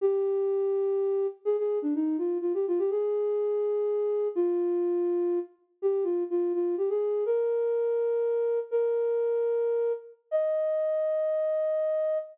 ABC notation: X:1
M:3/4
L:1/16
Q:1/4=124
K:Eb
V:1 name="Flute"
G12 | A A2 D E2 F2 F G F G | A12 | F10 z2 |
G2 F2 F2 F2 G A3 | B12 | "^rit." B10 z2 | e12 |]